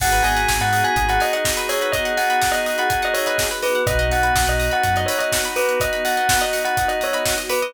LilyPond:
<<
  \new Staff \with { instrumentName = "Tubular Bells" } { \time 4/4 \key gis \minor \tempo 4 = 124 fis''8 gis''8. fis''8 gis''8 fis''16 dis''16 dis''16 r8 cis''8 | dis''8 fis''8. dis''8 fis''8 dis''16 cis''16 dis''16 r8 b'8 | dis''8 fis''8. dis''8 fis''8 dis''16 cis''16 dis''16 r8 b'8 | dis''8 fis''8. dis''8 fis''8 dis''16 cis''16 dis''16 r8 b'8 | }
  \new Staff \with { instrumentName = "Drawbar Organ" } { \time 4/4 \key gis \minor <b dis' fis' gis'>1~ | <b dis' fis' gis'>1 | <b dis' fis'>1~ | <b dis' fis'>1 | }
  \new Staff \with { instrumentName = "Pizzicato Strings" } { \time 4/4 \key gis \minor gis'16 b'16 dis''16 fis''16 gis''16 b''16 dis'''16 fis'''16 dis'''16 b''16 gis''16 fis''16 dis''16 b'16 gis'16 b'16 | dis''16 fis''16 gis''16 b''16 dis'''16 fis'''16 dis'''16 b''16 gis''16 fis''16 dis''16 b'16 gis'16 b'16 dis''16 fis''16 | b'16 dis''16 fis''16 b''16 dis'''16 fis'''16 dis'''16 b''16 fis''16 dis''16 b'16 dis''16 fis''16 b''16 dis'''16 fis'''16 | dis'''16 b''16 fis''16 dis''16 b'16 dis''16 fis''16 b''16 dis'''16 fis'''16 dis'''16 b''16 fis''16 dis''16 b'16 dis''16 | }
  \new Staff \with { instrumentName = "Synth Bass 2" } { \clef bass \time 4/4 \key gis \minor gis,,8 gis,,8 gis,,16 gis,8. gis,,2~ | gis,,1 | b,,8 b,,8 b,,16 b,,8. fis,2~ | fis,1 | }
  \new Staff \with { instrumentName = "Pad 2 (warm)" } { \time 4/4 \key gis \minor <b dis' fis' gis'>1~ | <b dis' fis' gis'>1 | <b dis' fis'>1~ | <b dis' fis'>1 | }
  \new DrumStaff \with { instrumentName = "Drums" } \drummode { \time 4/4 <cymc bd>16 hh16 hho16 hh16 <bd sn>16 hh16 hho16 hh16 <hh bd>16 hh16 hho16 hh16 <bd sn>16 hh16 hho16 hh16 | <hh bd>16 hh16 hho16 hh16 <bd sn>16 hh16 hho16 hh16 <hh bd>16 hh16 hho16 hh16 <bd sn>16 hh16 hho16 hh16 | <hh bd>16 hh16 hho16 hh16 <bd sn>16 hh16 hho16 hh16 <hh bd>16 hh16 hho16 hh16 <bd sn>16 hh16 hho16 hh16 | <hh bd>16 hh16 hho16 hh16 <bd sn>16 hh16 hho16 hh16 <hh bd>16 hh16 hho16 hh16 <bd sn>16 hh16 hho16 hh16 | }
>>